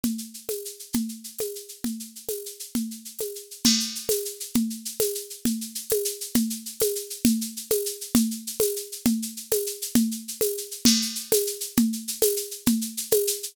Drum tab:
CC |------|------|------|------|
TB |---x--|---x--|---x--|---x--|
SH |xxxxxx|xxxxxx|xxxxxx|xxxxxx|
CG |O--o--|O--o--|O--o--|O--o--|

CC |x-----|------|------|------|
TB |---x--|---x--|---x--|---x--|
SH |xxxxxx|xxxxxx|xxxxxx|xxxxxx|
CG |O--o--|O--o--|O--o--|O--o--|

CC |------|------|------|------|
TB |---x--|---x--|---x--|---x--|
SH |xxxxxx|xxxxxx|xxxxxx|xxxxxx|
CG |O--o--|O--o--|O--o--|O--o--|

CC |x-----|------|------|
TB |---x--|---x--|---x--|
SH |xxxxxx|xxxxxx|xxxxxx|
CG |O--o--|O--o--|O--o--|